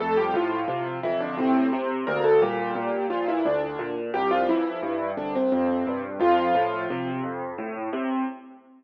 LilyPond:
<<
  \new Staff \with { instrumentName = "Acoustic Grand Piano" } { \time 3/4 \key f \major \tempo 4 = 87 <a a'>16 <g g'>16 <f f'>4 <e e'>16 <d d'>16 <c c'>8. r16 | <bes bes'>16 <a a'>16 <g g'>4 <f f'>16 <e e'>16 <d d'>8. r16 | <g g'>16 <f f'>16 <e e'>4 <d d'>16 <c c'>16 <c c'>8. r16 | <f f'>4. r4. | }
  \new Staff \with { instrumentName = "Acoustic Grand Piano" } { \clef bass \time 3/4 \key f \major f,8 a,8 c8 f,8 a,8 c8 | d,8 bes,8 bes,8 bes,8 d,8 bes,8 | c,8 f,8 g,8 c,8 f,8 g,8 | f,8 a,8 c8 f,8 a,8 c8 | }
>>